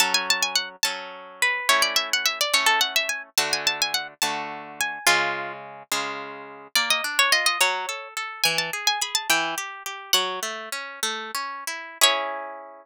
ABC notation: X:1
M:6/8
L:1/16
Q:3/8=71
K:F#m
V:1 name="Orchestral Harp"
a g a g f z a4 B2 | c d e f e d c A f e g z | a g a g f z a4 g2 | ^E4 z8 |
[K:C#m] =d ^d z c d d c4 z2 | g a z g b a =g4 z2 | "^rit." f4 z8 | c12 |]
V:2 name="Orchestral Harp"
[F,CA]6 [F,CA]6 | [A,CE]6 [A,CE]6 | [D,A,F]6 [D,A,F]6 | [C,G,]6 [C,G,^E]6 |
[K:C#m] ^A,2 =D2 ^E2 F,2 =A2 A2 | E,2 G2 G2 E,2 =G2 G2 | "^rit." F,2 A,2 C2 A,2 C2 E2 | [CEG]12 |]